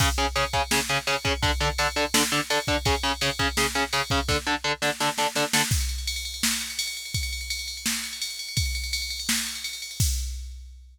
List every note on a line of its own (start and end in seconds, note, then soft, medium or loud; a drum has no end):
0.00 0.07 C#3 medium
0.00 0.07 C#4 medium
0.00 0.07 G#4 medium
0.00 kick loud
0.00 crash loud
0.18 0.25 C#3 medium
0.18 0.25 C#4 medium
0.18 0.25 G#4 medium
0.18 ride medium
0.36 0.43 C#3 medium
0.36 0.43 C#4 medium
0.36 0.43 G#4 medium
0.36 ride medium
0.53 0.61 C#3 medium
0.53 0.61 C#4 medium
0.53 0.61 G#4 medium
0.53 kick medium
0.53 ride medium
0.71 0.78 C#3 medium
0.71 0.78 C#4 medium
0.71 0.78 G#4 medium
0.71 snare loud
0.89 0.97 C#3 medium
0.89 0.97 C#4 medium
0.89 0.97 G#4 medium
0.89 ride medium
1.07 1.14 C#3 medium
1.07 1.14 C#4 medium
1.07 1.14 G#4 medium
1.07 ride medium
1.25 1.32 C#3 medium
1.25 1.32 C#4 medium
1.25 1.32 G#4 medium
1.25 kick medium
1.25 ride medium
1.42 1.50 D3 medium
1.42 1.50 D4 loud
1.42 1.50 A4 medium
1.42 kick medium
1.42 ride medium
1.60 1.68 D3 medium
1.60 1.68 D4 medium
1.60 1.68 A4 medium
1.60 ride medium
1.78 1.86 D3 medium
1.78 1.86 D4 medium
1.78 1.86 A4 medium
1.78 ride loud
1.96 2.03 D3 medium
1.96 2.03 D4 medium
1.96 2.03 A4 medium
1.96 ride medium
2.14 2.21 D3 medium
2.14 2.21 D4 medium
2.14 2.21 A4 medium
2.14 snare loud
2.32 2.39 D3 medium
2.32 2.39 D4 medium
2.32 2.39 A4 medium
2.32 ride medium
2.50 2.58 D3 medium
2.50 2.58 D4 medium
2.50 2.58 A4 medium
2.50 ride loud
2.67 2.75 D3 medium
2.67 2.75 D4 medium
2.67 2.75 A4 medium
2.67 kick medium
2.67 ride medium
2.85 2.93 C#3 medium
2.85 2.93 C#4 medium
2.85 2.93 G#4 medium
2.85 kick medium
2.85 ride loud
3.03 3.11 C#3 medium
3.03 3.11 C#4 medium
3.03 3.11 G#4 medium
3.03 ride medium
3.21 3.29 C#3 medium
3.21 3.29 C#4 medium
3.21 3.29 G#4 medium
3.21 ride loud
3.39 3.46 C#3 medium
3.39 3.46 C#4 loud
3.39 3.46 G#4 medium
3.39 kick medium
3.39 ride medium
3.57 3.65 C#3 medium
3.57 3.65 C#4 medium
3.57 3.65 G#4 medium
3.57 snare loud
3.75 3.82 C#3 medium
3.75 3.82 C#4 medium
3.75 3.82 G#4 medium
3.75 ride medium
3.93 4.00 C#3 medium
3.93 4.00 C#4 medium
3.93 4.00 G#4 medium
3.93 ride medium
4.10 4.18 C#3 medium
4.10 4.18 C#4 medium
4.10 4.18 G#4 medium
4.10 kick medium
4.10 ride medium
4.28 4.36 D3 medium
4.28 4.36 D4 loud
4.28 4.36 A4 medium
4.28 kick medium
4.28 snare medium
4.47 4.54 D3 medium
4.47 4.54 D4 medium
4.47 4.54 A4 medium
4.64 4.71 D3 medium
4.64 4.71 D4 medium
4.64 4.71 A4 medium
4.82 4.89 D3 medium
4.82 4.89 D4 medium
4.82 4.89 A4 medium
4.82 snare medium
5.00 5.08 D3 medium
5.00 5.08 D4 medium
5.00 5.08 A4 medium
5.00 snare medium
5.18 5.26 D3 medium
5.18 5.26 D4 medium
5.18 5.26 A4 medium
5.18 snare medium
5.35 5.43 D3 medium
5.35 5.43 D4 medium
5.35 5.43 A4 medium
5.35 snare medium
5.53 5.61 D3 medium
5.53 5.61 D4 medium
5.53 5.61 A4 medium
5.53 snare loud
5.71 kick loud
5.71 crash medium
5.80 ride medium
5.89 ride medium
5.98 ride medium
6.07 ride loud
6.16 ride medium
6.25 ride medium
6.34 ride medium
6.43 snare loud
6.52 ride medium
6.61 ride medium
6.70 ride medium
6.79 ride loud
6.87 ride medium
6.97 ride medium
7.05 ride medium
7.14 kick medium
7.14 ride loud
7.23 ride medium
7.33 ride medium
7.41 ride medium
7.50 ride loud
7.59 ride medium
7.68 ride medium
7.77 ride medium
7.86 snare loud
7.95 ride medium
8.04 ride medium
8.13 ride medium
8.22 ride loud
8.30 ride medium
8.39 ride medium
8.49 ride medium
8.57 kick loud
8.57 ride loud
8.66 ride medium
8.75 ride medium
8.84 ride medium
8.93 ride loud
9.02 ride medium
9.10 ride medium
9.20 ride medium
9.29 snare loud
9.38 ride medium
9.46 ride medium
9.55 ride medium
9.64 ride medium
9.73 ride medium
9.82 ride medium
9.91 ride medium
10.00 kick loud
10.00 crash loud